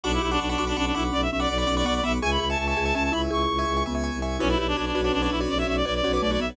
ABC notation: X:1
M:6/8
L:1/16
Q:3/8=110
K:Bdor
V:1 name="Clarinet"
D E E D D D2 D D D E z | d e e d d d2 d d d e z | g b b a a a2 a a a b z | c'6 z6 |
C E E D D D2 D D D E z | d e e d d d2 d' d d e z |]
V:2 name="Marimba"
F2 =G2 z2 F2 C2 D2 | C2 C2 z2 C2 B,2 B,2 | G2 G2 z2 G2 C2 E2 | [EG]6 B,4 z2 |
E2 =G2 z2 F2 C2 D2 | C2 C2 z2 C2 A,2 B,2 |]
V:3 name="Acoustic Grand Piano"
[fbc'd']3 [fbc'd']2 [fbc'd'] [fbc'd'] [fbc'd'] [fbc'd']2 [fbc'd']2- | [fbc'd']3 [fbc'd']2 [fbc'd'] [fbc'd'] [fbc'd'] [fbc'd']2 [fbc'd']2 | [egc']3 [egc']2 [egc'] [egc'] [egc'] [egc']2 [egc']2- | [egc']3 [egc']2 [egc'] [egc'] [egc'] [egc']2 [egc']2 |
[FBcd] [FBcd]3 [FBcd]2 [FBcd] [FBcd]2 [FBcd]2 [FBcd]- | [FBcd] [FBcd]3 [FBcd]2 [FBcd] [FBcd]2 [FBcd]2 [FBcd] |]
V:4 name="Violin" clef=bass
B,,,2 B,,,2 B,,,2 B,,,2 B,,,2 B,,,2 | B,,,2 B,,,2 B,,,2 B,,,2 B,,,2 B,,,2 | C,,2 C,,2 C,,2 C,,2 C,,2 C,,2 | C,,2 C,,2 C,,2 C,,3 =C,,3 |
B,,,2 B,,,2 B,,,2 B,,,2 B,,,2 B,,,2 | B,,,2 B,,,2 B,,,2 B,,,2 B,,,2 B,,,2 |]